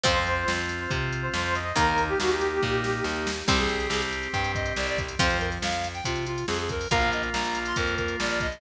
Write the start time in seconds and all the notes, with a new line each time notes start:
0.03 F2 F3 C4 F4 C5, kick, closed hi-hat
0.27 closed hi-hat
0.48 F2, snare
0.69 closed hi-hat
0.80 C5
0.90 C3, kick, closed hi-hat
1.12 closed hi-hat
1.22 C5
1.33 F2 C5, snare
1.44 C5
1.55 D#5, closed hi-hat
1.76 D#2 D#3 A#3 D#4 A#4, kick, closed hi-hat
1.98 closed hi-hat
2.08 G4
2.20 D#2 F#4, snare
2.32 G4
2.41 closed hi-hat
2.62 A#2, kick, snare
2.84 snare
3.04 D#2, snare
3.27 snare
3.48 C2 G3 C4 G4, kick, crash
3.58 G#4, closed hi-hat
3.69 closed hi-hat
3.80 closed hi-hat
3.90 C2 G#4, snare
4.02 closed hi-hat
4.13 closed hi-hat
4.23 closed hi-hat
4.33 G2 G5, kick, closed hi-hat
4.44 closed hi-hat
4.55 D#5, kick, closed hi-hat
4.66 closed hi-hat
4.76 C2 D5, snare
4.87 D5, closed hi-hat
4.98 kick, closed hi-hat
5.08 closed hi-hat
5.19 F2 F3 C4 C5, kick, closed hi-hat
5.30 closed hi-hat
5.39 A#4, closed hi-hat
5.52 closed hi-hat
5.62 F2 F5, snare
5.72 closed hi-hat
5.84 closed hi-hat
5.94 G5, closed hi-hat
6.04 C3 F4, kick, closed hi-hat
6.16 closed hi-hat
6.26 F4, closed hi-hat
6.38 closed hi-hat
6.47 F2 G#4, snare
6.59 G#4, closed hi-hat
6.69 A#4, kick, closed hi-hat
6.81 open hi-hat
6.91 A#1 A#3 F4 A#4 F5, kick, closed hi-hat
7.02 closed hi-hat
7.12 D#5, closed hi-hat
7.23 closed hi-hat
7.32 A#1 A#5, snare
7.45 closed hi-hat
7.55 closed hi-hat
7.66 C6, closed hi-hat
7.76 F2 A#4, kick, closed hi-hat
7.87 closed hi-hat
7.97 A#4, kick, closed hi-hat
8.08 closed hi-hat
8.20 A#1 D5, snare
8.29 D5, closed hi-hat
8.40 D#5, kick, closed hi-hat
8.52 closed hi-hat